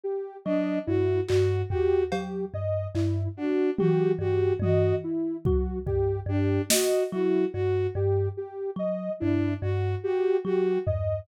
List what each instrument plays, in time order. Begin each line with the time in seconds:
0.04 ocarina G4
0.45 kalimba F#3, violin D4, ocarina D#5
0.87 kalimba G2, ocarina E4, violin F#4
1.28 kalimba G2, ocarina F#4, violin F#4, clap
1.70 violin F#4, ocarina G4, floor tom
2.12 kalimba F#3, ocarina G4, cowbell
2.54 kalimba G2, ocarina D#5
2.95 kalimba G2, ocarina E4, clap
3.37 violin D4, ocarina F#4
3.78 kalimba F#3, violin F#4, ocarina G4, high tom
4.19 kalimba G2, violin F#4, ocarina G4
4.60 kalimba G2, violin F#4, ocarina D#5, high tom
5.04 ocarina E4
5.45 kalimba F#3, ocarina F#4, kick
5.86 kalimba G2, ocarina G4, kick
6.26 kalimba G2, violin D4, ocarina G4
6.70 violin F#4, ocarina D#5, snare
7.12 kalimba F#3, ocarina E4, violin F#4
7.53 kalimba G2, ocarina F#4, violin F#4
7.95 kalimba G2, ocarina G4
8.37 ocarina G4
8.76 kalimba F#3, ocarina D#5
9.20 kalimba G2, violin D4, ocarina E4
9.62 kalimba G2, violin F#4, ocarina F#4
10.04 violin F#4, ocarina G4
10.45 kalimba F#3, violin F#4, ocarina G4
10.86 kalimba G2, ocarina D#5, floor tom